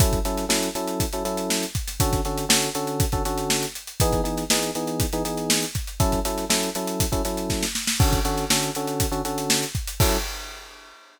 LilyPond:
<<
  \new Staff \with { instrumentName = "Electric Piano 1" } { \time 4/4 \key fis \minor \tempo 4 = 120 <fis cis' e' a'>8 <fis cis' e' a'>8 <fis cis' e' a'>8 <fis cis' e' a'>8. <fis cis' e' a'>16 <fis cis' e' a'>4. | <d cis' fis' a'>8 <d cis' fis' a'>8 <d cis' fis' a'>8 <d cis' fis' a'>8. <d cis' fis' a'>16 <d cis' fis' a'>4. | <e b dis' gis'>8 <e b dis' gis'>8 <e b dis' gis'>8 <e b dis' gis'>8. <e b dis' gis'>16 <e b dis' gis'>4. | <fis cis' e' a'>8 <fis cis' e' a'>8 <fis cis' e' a'>8 <fis cis' e' a'>8. <fis cis' e' a'>16 <fis cis' e' a'>4. |
<d cis' fis' a'>8 <d cis' fis' a'>8 <d cis' fis' a'>8 <d cis' fis' a'>8. <d cis' fis' a'>16 <d cis' fis' a'>4. | <fis cis' e' a'>4 r2. | }
  \new DrumStaff \with { instrumentName = "Drums" } \drummode { \time 4/4 <hh bd>16 <hh bd>16 hh16 <hh sn>16 sn16 hh16 hh16 hh16 <hh bd>16 hh16 hh16 hh16 sn16 hh16 <hh bd>16 <hh sn>16 | <hh bd>16 <hh bd sn>16 <hh sn>16 hh16 sn16 hh16 hh16 hh16 <hh bd>16 <hh bd>16 hh16 hh16 sn16 <hh sn>16 hh16 hh16 | <hh bd>16 <hh bd>16 hh16 <hh sn>16 sn16 hh16 hh16 hh16 <hh bd>16 hh16 hh16 hh16 sn16 hh16 <hh bd sn>16 hh16 | <hh bd>16 <hh bd>16 hh16 <hh sn>16 sn16 <hh sn>16 hh16 hh16 <hh bd>16 <hh bd>16 <hh sn>16 hh16 <bd sn>16 sn16 sn16 sn16 |
<cymc bd>16 <hh bd>16 hh16 <hh sn>16 sn16 hh16 hh16 hh16 <hh bd>16 hh16 hh16 hh16 sn16 <hh sn>16 <hh bd>16 hh16 | <cymc bd>4 r4 r4 r4 | }
>>